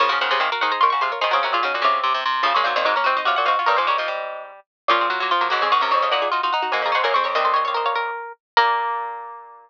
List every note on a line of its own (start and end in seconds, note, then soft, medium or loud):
0.00 0.10 C#3 medium
0.00 0.10 F3 loud
0.00 0.09 A#4 medium
0.00 0.09 C#5 medium
0.09 0.20 C#3 loud
0.09 0.19 F3 medium
0.09 0.19 F#4 medium
0.09 0.19 A#4 medium
0.09 0.21 G#5 medium
0.21 0.31 C#3 medium
0.21 0.31 D#3 medium
0.21 0.31 G#4 medium
0.21 0.31 C5 medium
0.21 0.30 F#5 medium
0.31 0.40 C3 medium
0.31 0.41 C#3 loud
0.31 0.40 G#4 medium
0.31 0.40 C5 medium
0.31 0.41 F#5 medium
0.40 0.50 C3 loud
0.40 0.50 D#3 medium
0.40 0.50 G#4 medium
0.40 0.50 C5 medium
0.40 0.50 F5 medium
0.52 0.62 F#4 medium
0.52 0.62 A#4 medium
0.52 0.62 F5 medium
0.61 0.71 D#3 loud
0.61 0.82 D#4 medium
0.61 0.71 G#4 medium
0.61 0.71 C5 medium
0.61 0.71 F#5 medium
0.72 0.81 G#4 medium
0.72 0.81 C5 medium
0.72 0.81 A#5 medium
0.81 0.93 D#3 loud
0.81 0.90 F4 medium
0.81 0.92 A#4 medium
0.81 0.92 C#5 medium
0.81 0.90 C6 medium
0.90 1.02 C#3 loud
0.90 1.02 F#4 medium
0.90 1.00 C#6 medium
1.01 1.12 C3 loud
1.01 1.19 F4 medium
1.01 1.11 G#4 medium
1.01 1.11 C5 medium
1.01 1.12 C6 medium
1.12 1.22 A#4 medium
1.12 1.22 C#5 medium
1.21 1.33 D#3 loud
1.21 1.31 D#4 medium
1.21 1.31 G#4 medium
1.21 1.31 C5 medium
1.21 1.33 D#5 medium
1.31 1.44 C#3 loud
1.31 1.43 C4 medium
1.31 1.41 F#4 medium
1.31 1.41 A#4 medium
1.31 2.14 C#5 medium
1.43 1.53 C3 loud
1.43 1.53 C#4 medium
1.43 1.54 F#4 medium
1.43 1.54 A#4 medium
1.53 1.62 A#2 loud
1.53 1.64 F4 medium
1.53 1.64 G#4 medium
1.63 1.74 C#3 loud
1.63 1.73 C#4 medium
1.63 1.73 D#4 medium
1.63 1.73 F#4 medium
1.74 1.84 A#2 medium
1.74 1.85 D#4 medium
1.74 1.85 F#4 medium
1.82 2.21 C3 loud
1.82 2.00 C#3 medium
1.82 2.21 C#4 medium
1.82 2.21 F4 medium
2.03 2.13 C3 medium
2.14 2.24 C3 medium
2.26 2.43 C3 medium
2.43 2.55 C#3 loud
2.43 2.53 F3 loud
2.43 2.53 C#4 medium
2.43 2.53 F4 medium
2.54 2.63 A#2 loud
2.54 2.66 G#3 medium
2.54 2.66 A#3 medium
2.54 2.66 C#4 medium
2.54 2.65 C#5 medium
2.64 2.73 A#2 loud
2.64 2.76 F#3 medium
2.64 2.75 C4 medium
2.64 2.75 D#4 medium
2.64 2.74 C5 medium
2.76 2.85 A#2 loud
2.76 2.86 D#3 medium
2.76 2.85 C4 medium
2.76 2.85 D#4 medium
2.76 2.86 C5 medium
2.85 2.94 G#2 loud
2.85 2.96 F#3 medium
2.85 2.95 C4 medium
2.85 2.95 D#4 medium
2.85 2.95 A#4 medium
2.96 3.06 A#3 medium
2.96 3.06 C#4 medium
2.96 3.06 A#4 medium
3.04 3.16 C3 loud
3.04 3.16 C4 medium
3.04 3.16 D#4 medium
3.04 3.21 F#4 medium
3.04 3.17 C5 medium
3.17 3.26 C4 medium
3.17 3.26 D#4 medium
3.17 3.28 D#5 medium
3.25 3.36 C3 loud
3.25 3.37 C#4 medium
3.25 3.37 F4 medium
3.25 3.35 F#4 medium
3.25 3.37 F5 medium
3.36 3.47 A#2 loud
3.36 3.48 F#4 medium
3.36 3.46 F#5 medium
3.45 3.57 G#2 loud
3.45 3.56 C4 medium
3.45 3.56 D#4 medium
3.45 3.68 F#4 medium
3.45 3.55 F5 medium
3.59 3.69 C#4 medium
3.59 3.69 F4 medium
3.66 3.77 G2 loud
3.66 3.78 G3 medium
3.66 3.76 A#4 medium
3.66 3.78 A#4 medium
3.66 3.78 C#5 medium
3.77 4.52 G#2 loud
3.77 3.88 F3 medium
3.77 3.88 G#4 medium
3.77 3.86 C5 medium
3.77 3.88 C5 medium
3.87 3.97 G3 medium
3.87 4.46 G4 medium
3.87 4.46 A#4 medium
3.87 3.98 C#5 medium
3.98 4.09 F3 medium
3.98 4.43 D#5 medium
4.08 4.60 G3 medium
4.88 5.08 A#2 loud
4.88 5.09 F3 medium
4.88 5.00 A#3 medium
4.88 5.00 C#4 medium
4.88 5.30 F4 medium
5.01 5.11 G#3 medium
5.01 5.11 C4 medium
5.10 5.20 F#3 medium
5.10 5.20 A#3 medium
5.20 5.30 F#3 medium
5.20 5.32 F#3 medium
5.20 5.32 A#3 medium
5.31 5.51 F3 medium
5.31 5.47 F4 medium
5.41 5.49 F#3 medium
5.41 5.49 A#3 medium
5.50 5.62 G#2 loud
5.50 5.71 C#3 medium
5.50 5.60 F#3 medium
5.50 5.60 A#3 medium
5.50 5.61 F#4 medium
5.61 5.71 F2 loud
5.61 5.73 G#3 medium
5.61 5.71 C4 medium
5.61 5.72 G#4 medium
5.72 5.81 G#2 medium
5.72 5.81 D#3 medium
5.72 5.82 C4 medium
5.72 5.82 D#4 medium
5.72 5.82 F#4 medium
5.81 5.91 F#2 medium
5.81 5.92 C3 medium
5.81 5.91 A#3 medium
5.81 5.91 C#4 medium
5.81 5.91 A#4 medium
5.91 6.02 F2 medium
5.91 6.09 C#3 medium
5.91 6.01 C4 medium
5.91 6.01 D#4 medium
5.91 6.01 C#5 medium
6.02 6.12 F2 medium
6.02 6.12 C#4 medium
6.02 6.12 F4 medium
6.02 6.13 D#5 medium
6.11 6.28 A#2 loud
6.11 6.30 D#4 medium
6.11 6.21 F#4 medium
6.11 6.21 A#4 medium
6.11 6.49 F#5 medium
6.22 6.32 F4 medium
6.22 6.32 G#4 medium
6.32 6.42 D#4 medium
6.32 6.41 F4 medium
6.32 6.42 F#4 medium
6.43 6.53 D#4 medium
6.43 6.53 F4 medium
6.43 6.53 F#4 medium
6.53 6.73 D#4 medium
6.53 6.69 F#5 medium
6.62 6.72 D#4 medium
6.62 6.72 F#4 medium
6.72 6.81 G#2 medium
6.72 6.93 A#3 medium
6.72 6.83 D#4 medium
6.72 6.83 F#4 medium
6.72 6.82 G#5 medium
6.82 6.91 F2 medium
6.82 6.95 A#5 medium
6.86 6.96 F4 medium
6.86 6.94 G#4 medium
6.92 7.05 G#2 medium
6.92 7.02 C#4 medium
6.92 7.05 G#4 medium
6.92 7.05 C5 medium
6.92 7.04 F#5 medium
7.04 7.14 F#2 loud
7.04 7.14 A#3 medium
7.04 7.14 F#4 medium
7.04 7.14 A#4 medium
7.04 7.13 G#5 medium
7.14 7.24 F2 medium
7.14 7.35 C4 medium
7.14 7.26 G#4 medium
7.14 7.26 C5 medium
7.14 7.23 C#6 medium
7.24 7.34 F2 medium
7.24 7.35 A#4 medium
7.24 7.35 C#5 medium
7.24 7.34 C#6 medium
7.35 8.11 C2 medium
7.35 8.11 D#2 loud
7.35 8.22 C4 medium
7.35 7.44 C5 medium
7.35 7.45 D#5 medium
7.35 7.54 D#5 medium
7.45 7.55 A4 medium
7.45 7.55 C5 medium
7.54 7.66 C5 medium
7.54 7.63 C#5 medium
7.54 7.66 D#5 medium
7.65 7.74 C#5 medium
7.65 7.77 C#5 medium
7.65 7.77 F5 medium
7.74 7.94 A#4 medium
7.74 7.86 C5 medium
7.74 7.86 D#5 medium
7.86 8.33 C#5 medium
7.86 8.33 F5 medium
7.95 8.32 A#4 medium
8.57 9.70 A#2 loud
8.57 9.70 A#3 loud
8.57 9.70 A#4 loud